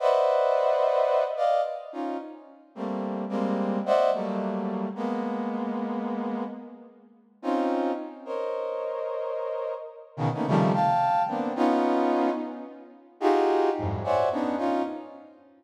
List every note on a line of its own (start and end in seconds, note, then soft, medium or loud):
0.00 1.24 B4 loud
0.00 1.24 C5 loud
0.00 1.24 D5 loud
0.00 1.24 D#5 loud
0.00 1.24 E5 loud
0.00 1.24 F#5 loud
1.37 1.61 D5 medium
1.37 1.61 D#5 medium
1.37 1.61 F5 medium
1.92 2.17 C#4 medium
1.92 2.17 D#4 medium
1.92 2.17 F4 medium
2.75 3.25 G3 soft
2.75 3.25 A3 soft
2.75 3.25 A#3 soft
2.75 3.25 C4 soft
3.29 3.79 G3 medium
3.29 3.79 G#3 medium
3.29 3.79 A#3 medium
3.29 3.79 C4 medium
3.86 4.11 C5 loud
3.86 4.11 D5 loud
3.86 4.11 D#5 loud
3.86 4.11 E5 loud
3.86 4.11 F#5 loud
4.13 4.87 F#3 medium
4.13 4.87 G3 medium
4.13 4.87 A3 medium
4.13 4.87 A#3 medium
4.95 6.44 G#3 medium
4.95 6.44 A#3 medium
4.95 6.44 B3 medium
7.42 7.92 C4 medium
7.42 7.92 C#4 medium
7.42 7.92 D#4 medium
7.42 7.92 F4 medium
8.25 9.74 A#4 soft
8.25 9.74 C5 soft
8.25 9.74 C#5 soft
8.25 9.74 D#5 soft
10.17 10.29 B2 loud
10.17 10.29 C#3 loud
10.17 10.29 D#3 loud
10.34 10.46 A3 medium
10.34 10.46 A#3 medium
10.34 10.46 B3 medium
10.34 10.46 C#4 medium
10.34 10.46 D#4 medium
10.47 10.72 C3 loud
10.47 10.72 C#3 loud
10.47 10.72 D#3 loud
10.47 10.72 F3 loud
10.47 10.72 G3 loud
10.47 10.72 A3 loud
10.73 11.23 F5 loud
10.73 11.23 G5 loud
10.73 11.23 A5 loud
11.28 11.53 A#3 medium
11.28 11.53 B3 medium
11.28 11.53 C4 medium
11.28 11.53 D4 medium
11.56 12.30 B3 loud
11.56 12.30 C#4 loud
11.56 12.30 D#4 loud
11.56 12.30 F4 loud
13.20 13.70 D#4 loud
13.20 13.70 F4 loud
13.20 13.70 F#4 loud
13.20 13.70 G4 loud
13.20 13.70 G#4 loud
13.77 14.02 F2 medium
13.77 14.02 G2 medium
13.77 14.02 G#2 medium
13.77 14.02 A2 medium
14.04 14.29 C5 medium
14.04 14.29 C#5 medium
14.04 14.29 D5 medium
14.04 14.29 E5 medium
14.04 14.29 F#5 medium
14.04 14.29 G#5 medium
14.32 14.56 B3 medium
14.32 14.56 C#4 medium
14.32 14.56 D4 medium
14.32 14.56 D#4 medium
14.57 14.82 C#4 medium
14.57 14.82 D#4 medium
14.57 14.82 F4 medium